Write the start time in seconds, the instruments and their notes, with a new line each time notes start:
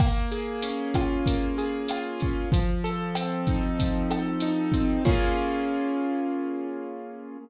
0.00 acoustic grand piano A#3, kick, cross-stick, crash
0.32 acoustic grand piano G#4, closed hi-hat
0.63 acoustic grand piano C#4, closed hi-hat
0.94 acoustic grand piano F4, kick, cross-stick, closed hi-hat
1.26 acoustic grand piano A#3, kick, closed hi-hat
1.58 acoustic grand piano G#4, closed hi-hat
1.88 acoustic grand piano F4, cross-stick, closed hi-hat
2.20 acoustic grand piano C#4, kick, closed hi-hat
2.52 acoustic grand piano F3, kick, closed hi-hat
2.84 acoustic grand piano A4, closed hi-hat
3.15 acoustic grand piano C4, cross-stick, closed hi-hat
3.47 acoustic grand piano D#4, kick, closed hi-hat
3.79 acoustic grand piano F3, kick, closed hi-hat
4.10 acoustic grand piano A4, cross-stick, closed hi-hat
4.40 acoustic grand piano D#4, closed hi-hat
4.72 acoustic grand piano C4, kick, closed hi-hat
5.05 acoustic grand piano A#3 C#4 F4 G#4, kick, crash